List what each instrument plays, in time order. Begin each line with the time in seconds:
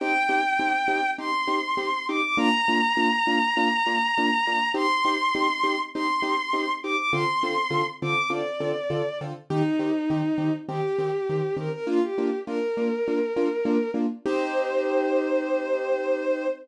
0.00 acoustic grand piano C4 D#4 G4, violin G5
0.29 acoustic grand piano C4 D#4 G4
0.59 acoustic grand piano C4 D#4 G4
0.88 acoustic grand piano C4 D#4 G4
1.18 acoustic grand piano C4 D#4 G4, violin C6
1.47 acoustic grand piano C4 D#4 G4
1.77 acoustic grand piano C4 D#4 G4
2.08 acoustic grand piano C4 D#4 G4, violin D6
2.23 violin D6
2.37 acoustic grand piano A#3 D4 F4, violin A#5
2.68 acoustic grand piano A#3 D4 F4
2.97 acoustic grand piano A#3 D4 F4
3.27 acoustic grand piano A#3 D4 F4
3.57 acoustic grand piano A#3 D4 F4
3.86 acoustic grand piano A#3 D4 F4
4.18 acoustic grand piano A#3 D4 F4
4.47 acoustic grand piano A#3 D4 F4
4.74 acoustic grand piano C4 D#4 G4, violin C6
5.05 acoustic grand piano C4 D#4 G4
5.35 acoustic grand piano C4 D#4 G4
5.63 acoustic grand piano C4 D#4 G4
5.94 acoustic grand piano C4 D#4 G4, violin C6
6.22 acoustic grand piano C4 D#4 G4
6.53 acoustic grand piano C4 D#4 G4
6.83 acoustic grand piano C4 D#4 G4, violin D6
6.98 violin D6
7.13 acoustic grand piano D3 C4 F4 A4, violin C6
7.43 acoustic grand piano D3 C4 F4 A4
7.70 acoustic grand piano D3 C4 F4 A4
8.02 acoustic grand piano D3 C4 F4 A4, violin D6
8.30 acoustic grand piano D3 C4 F4 A4, violin D5
8.60 acoustic grand piano D3 C4 F4 A4
8.90 acoustic grand piano D3 C4 F4 A4
9.21 acoustic grand piano D3 C4 F4 A4
9.50 acoustic grand piano D#3 C4 G4, violin D#4
9.79 acoustic grand piano D#3 C4 G4
10.10 acoustic grand piano D#3 C4 G4
10.38 acoustic grand piano D#3 C4 G4
10.69 acoustic grand piano D#3 C4 G4, violin G4
10.99 acoustic grand piano D#3 C4 G4
11.29 acoustic grand piano D#3 C4 G4
11.57 acoustic grand piano D#3 C4 G4, violin A#4
11.72 violin A#4
11.87 acoustic grand piano A#3 D4 F4, violin F4
12.03 violin G4
12.18 acoustic grand piano A#3 D4 F4
12.47 acoustic grand piano A#3 D4 F4, violin A#4
12.77 acoustic grand piano A#3 D4 F4
13.08 acoustic grand piano A#3 D4 F4
13.36 acoustic grand piano A#3 D4 F4
13.65 acoustic grand piano A#3 D4 F4
13.94 acoustic grand piano A#3 D4 F4
14.26 acoustic grand piano C4 D#4 G4, violin C5